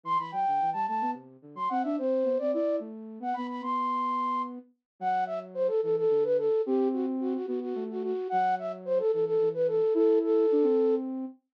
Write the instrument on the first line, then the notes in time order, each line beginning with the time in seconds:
flute
0.03 E3 C6
0.18 E3 B5
0.32 F#3 G5
0.47 D3
0.61 E3
0.73 G3 A5
0.87 A3 A5
1.01 B3
1.14 C3
1.42 D3
1.55 F#3 C6
1.69 C4 F#5
1.83 D4 E5
1.98 C4 C5
2.24 B3
2.38 C4 D5
2.52 E4 D5
2.79 A3
3.20 B3 F#5
3.34 B3 B5
3.49 B5
3.62 B3 C6
5.00 F#3 F#5
5.26 E5
5.54 C5
5.68 A4
5.83 E3 A4
5.97 A4
6.09 D3
6.24 B4
6.38 A4
6.66 C4 G4
6.93 F#4
7.20 F#4
7.35 F#4
7.46 B3 F#4
7.61 F#4
7.75 A3
7.90 F#4
8.03 F#4
8.29 F#3 F#5
8.59 E5
8.85 C5
8.99 A4
9.12 E3 A4
9.26 A4
9.40 E3
9.54 B4
9.67 A4
9.94 E4 A4
10.24 A4
10.51 D4
10.63 C4